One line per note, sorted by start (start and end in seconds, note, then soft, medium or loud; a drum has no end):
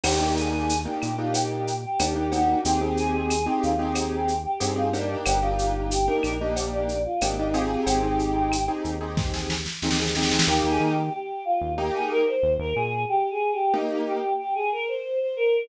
0.04 0.87 D#2 loud
0.04 0.17 A#3 medium
0.04 0.17 D4 medium
0.04 0.17 D#4 medium
0.04 0.17 G4 medium
0.04 0.34 G4 medium
0.04 crash loud
0.04 cowbell medium
0.04 claves medium
0.20 0.72 A#3 medium
0.20 0.72 D4 medium
0.20 0.72 D#4 medium
0.20 0.72 G4 medium
0.37 0.78 G#4 medium
0.37 shaker medium
0.69 shaker medium
0.85 1.11 A#3 medium
0.85 1.11 D4 medium
0.85 1.11 D#4 medium
0.85 1.11 G4 medium
0.85 1.01 G4 medium
1.02 1.86 A#2 medium
1.02 1.18 G4 medium
1.02 claves medium
1.02 shaker medium
1.18 1.71 A#3 medium
1.18 1.71 D4 medium
1.18 1.71 D#4 medium
1.18 1.33 F4 medium
1.18 1.71 G4 medium
1.34 1.74 G4 medium
1.34 cowbell medium
1.34 shaker loud
1.67 shaker medium
1.83 2.12 G4 medium
1.99 2.55 D#2 medium
1.99 2.13 A#3 medium
1.99 2.13 D4 medium
1.99 2.13 D#4 medium
1.99 2.13 G4 medium
1.99 cowbell medium
1.99 claves medium
1.99 shaker loud
2.15 2.28 A#3 medium
2.15 2.28 D4 medium
2.15 2.28 D#4 medium
2.15 2.28 G4 medium
2.15 2.32 G4 medium
2.32 2.58 A#3 medium
2.32 2.58 D4 medium
2.32 2.58 D#4 medium
2.32 2.60 F#4 medium
2.32 2.58 G4 medium
2.32 cowbell medium
2.32 shaker medium
2.65 3.48 D#2 medium
2.65 2.79 C4 medium
2.65 2.79 D#4 medium
2.65 2.96 G4 medium
2.65 2.79 G4 medium
2.65 2.79 G#4 medium
2.65 shaker loud
2.81 3.33 C4 medium
2.81 3.33 D#4 medium
2.81 3.33 G4 medium
2.81 3.33 G#4 medium
2.97 3.44 G#4 medium
2.97 shaker medium
3.30 claves medium
3.30 shaker medium
3.46 3.72 C4 medium
3.46 3.72 D#4 medium
3.46 3.62 G4 medium
3.46 3.72 G4 medium
3.46 3.72 G#4 medium
3.63 4.47 D#2 medium
3.63 3.78 F4 medium
3.63 shaker medium
3.79 4.31 C4 medium
3.79 4.31 D#4 medium
3.79 3.94 G4 medium
3.79 4.31 G4 medium
3.79 4.31 G#4 medium
3.95 4.36 G4 medium
3.95 cowbell medium
3.95 claves medium
3.95 shaker medium
4.28 shaker medium
4.45 4.72 G4 medium
4.60 5.16 G2 medium
4.60 4.73 C4 medium
4.60 4.73 D#4 medium
4.60 4.73 G4 medium
4.60 4.73 G#4 medium
4.60 cowbell medium
4.60 shaker medium
4.76 4.89 C4 medium
4.76 4.89 D#4 medium
4.76 4.92 F4 medium
4.76 4.89 G4 medium
4.76 4.89 G#4 medium
4.93 5.39 A#3 medium
4.93 5.20 D4 medium
4.93 5.39 D4 medium
4.93 5.39 D#4 medium
4.93 5.39 G4 medium
4.93 cowbell medium
4.93 shaker medium
5.26 6.09 G1 loud
5.26 5.41 G4 medium
5.26 cowbell medium
5.26 claves medium
5.26 shaker loud
5.42 5.95 A#3 medium
5.42 5.95 D4 medium
5.42 5.95 D#4 medium
5.42 5.72 F4 medium
5.42 5.95 G4 medium
5.59 shaker medium
5.75 5.91 F4 medium
5.91 6.06 G4 medium
5.91 shaker loud
6.07 6.34 A#3 medium
6.07 6.34 D4 medium
6.07 6.34 D#4 medium
6.07 6.34 G4 medium
6.07 6.38 A#4 medium
6.23 7.07 A#1 medium
6.23 claves medium
6.23 shaker medium
6.40 6.93 A#3 medium
6.40 6.93 D4 medium
6.40 6.93 D#4 medium
6.40 6.93 G4 medium
6.40 6.55 D#5 medium
6.56 cowbell medium
6.56 shaker medium
6.73 7.02 D5 medium
6.89 shaker medium
7.05 7.20 F4 medium
7.21 7.77 G#1 medium
7.21 7.35 A#3 medium
7.21 7.35 D4 medium
7.21 7.35 D#4 medium
7.21 7.37 G4 medium
7.21 7.35 G4 medium
7.21 cowbell medium
7.21 claves medium
7.21 shaker loud
7.38 7.52 A#3 medium
7.38 7.52 D4 medium
7.38 7.53 D#4 medium
7.38 7.52 D#4 medium
7.38 7.52 G4 medium
7.54 7.99 C4 medium
7.54 7.99 D#4 medium
7.54 7.81 F4 medium
7.54 7.99 G4 medium
7.54 7.99 G#4 medium
7.54 cowbell medium
7.54 shaker medium
7.86 8.69 G#1 medium
7.86 8.67 G4 medium
7.86 cowbell medium
7.86 shaker medium
8.03 8.55 C4 medium
8.03 8.55 D#4 medium
8.03 8.55 G4 medium
8.03 8.55 G#4 medium
8.19 shaker medium
8.52 claves medium
8.52 shaker medium
8.68 8.94 C4 medium
8.68 8.94 D#4 medium
8.68 8.94 G4 medium
8.68 8.94 G#4 medium
8.85 9.68 D#2 medium
8.85 shaker medium
9.01 9.53 C4 medium
9.01 9.53 D#4 medium
9.01 9.53 G4 medium
9.01 9.53 G#4 medium
9.17 kick medium
9.17 snare medium
9.34 snare medium
9.50 snare medium
9.66 snare medium
9.82 10.38 D#2 medium
9.82 9.96 C4 medium
9.82 9.96 D#4 medium
9.82 9.96 G4 medium
9.82 9.96 G#4 medium
9.82 snare medium
9.91 snare medium
9.99 10.13 C4 medium
9.99 10.13 D#4 medium
9.99 10.13 G4 medium
9.99 10.13 G#4 medium
9.99 snare medium
10.07 snare medium
10.15 10.43 C4 medium
10.15 10.43 D#4 medium
10.15 10.43 G4 medium
10.15 10.43 G#4 medium
10.15 snare medium
10.23 snare medium
10.31 snare medium
10.39 snare loud
10.47 10.62 D#2 loud
10.47 10.94 A#3 loud
10.47 10.94 D#4 loud
10.47 10.68 G4 medium
10.47 10.94 G4 loud
10.64 10.79 D#2 medium
10.69 10.89 G#4 medium
10.80 11.10 D#3 medium
10.91 11.12 G4 medium
11.13 11.44 G4 medium
11.45 11.72 F4 medium
11.61 11.91 D#2 medium
11.78 12.23 A#3 medium
11.78 12.23 D#4 loud
11.78 12.23 G4 medium
11.78 11.94 G4 medium
11.95 12.10 G#4 medium
12.11 12.26 A#4 medium
12.27 12.53 C5 medium
12.43 12.58 D#2 medium
12.59 12.74 D#2 medium
12.59 12.75 A#4 medium
12.76 13.05 A#2 medium
12.76 13.03 G#4 loud
13.09 13.29 G4 medium
13.31 13.51 G#4 medium
13.52 13.73 G4 medium
13.74 14.19 A#3 medium
13.74 14.19 D#4 medium
13.74 14.03 D#4 medium
13.74 14.19 G4 medium
14.07 14.33 G4 medium
14.38 14.54 G4 medium
14.55 14.71 G#4 medium
14.72 14.88 A#4 medium
14.88 15.19 C5 medium
15.20 15.36 C5 medium
15.36 15.64 A#4 medium